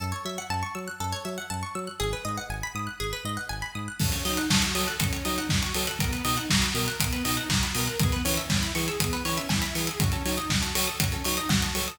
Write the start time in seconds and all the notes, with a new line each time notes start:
0.00 F#2 A4
0.12 C#5
0.25 F#3 E5
0.38 F#5
0.50 F#2 A5
0.63 C#6
0.75 F#3 E6
0.88 F#6
1.00 F#2 A4
1.12 C#5
1.25 F#3 E5
1.38 F#5
1.50 F#2 A5
1.63 C#6
1.75 F#3 E6
1.87 F#6
2.00 G#1 G#4
2.13 B4
2.25 G#2 D#5
2.38 F#5
2.50 G#1 G#5
2.63 B5
2.75 G#2 D#6
2.87 F#6
3.00 G#1 G#4
3.13 B4
3.24 G#2 D#5
3.37 F#5
3.49 G#1 G#5
3.62 B5
3.75 G#2 D#6
3.88 F#6
3.99 F#2 C#4 A4, kick, crash
4.12 C#5, closed hi-hat
4.25 F#3 D#4 D#5, open hi-hat
4.37 F#5, closed hi-hat
4.50 F#2 F#4 A5, kick, snare
4.62 C#6, closed hi-hat
4.74 F#3 A4 D#6, open hi-hat
4.88 F#6, closed hi-hat
5.00 F#2 C#4 A4, kick, closed hi-hat
5.13 C#5, closed hi-hat
5.24 F#3 D#4 D#5, open hi-hat
5.38 F#5, closed hi-hat
5.49 F#2 F#4 A5, kick, snare
5.62 C#6, closed hi-hat
5.74 F#3 A4 D#6, open hi-hat
5.87 F#6, closed hi-hat
5.99 B1 B3 A#4, kick, closed hi-hat
6.12 B4, closed hi-hat
6.24 B2 D#4 D#5, open hi-hat
6.37 F#5, closed hi-hat
6.50 B1 F#4 A#5, kick, snare
6.62 B5, closed hi-hat
6.74 B2 A#4 D#6, open hi-hat
6.88 F#6, closed hi-hat
7.00 B1 B3 A#4, kick, closed hi-hat
7.12 B4, closed hi-hat
7.24 B2 D#4 D#5, open hi-hat
7.37 F#5, closed hi-hat
7.49 B1 F#4 A#5, kick, snare
7.63 B5, closed hi-hat
7.74 B2 A#4 D#6, open hi-hat
7.87 F#6, closed hi-hat
7.99 E2 B3 G#4, kick, closed hi-hat
8.12 B4, closed hi-hat
8.24 E3 C#4 C#5, open hi-hat
8.37 E5, closed hi-hat
8.49 E2 E4 G#5, kick, snare
8.62 B5, closed hi-hat
8.74 E3 G#4 C#6, open hi-hat
8.88 E6, closed hi-hat
9.00 E2 B3 G#4, kick, closed hi-hat
9.13 B4, closed hi-hat
9.25 E3 C#4 C#5, open hi-hat
9.37 E5, closed hi-hat
9.49 E2 E4 G#5, kick, snare
9.62 B5, closed hi-hat
9.75 E3 G#4 C#6, open hi-hat
9.87 E6, closed hi-hat
10.00 F#2 C#4 F#4, kick, closed hi-hat
10.12 A4, closed hi-hat
10.25 F#3 D#4 C#5, open hi-hat
10.37 D#5, closed hi-hat
10.49 F#2 F#4 F#5, kick, snare
10.62 A5, closed hi-hat
10.75 F#3 A4 C#6, open hi-hat
10.87 D#6, closed hi-hat
11.00 F#2 C#4 F#4, kick, closed hi-hat
11.12 A4, closed hi-hat
11.24 F#3 D#4 C#5, open hi-hat
11.37 D#5, closed hi-hat
11.49 F#2 F#4 F#5, kick, snare
11.62 A5, closed hi-hat
11.75 F#3 A4 C#6, open hi-hat
11.88 D#6, closed hi-hat